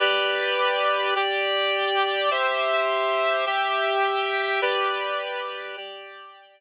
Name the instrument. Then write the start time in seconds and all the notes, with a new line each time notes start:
clarinet
0.00 G4 B4 D5
1.15 G4 D5 G5
2.31 G4 C5 E5
3.46 G4 E5 G5
4.62 G4 B4 D5
5.77 G4 D5 G5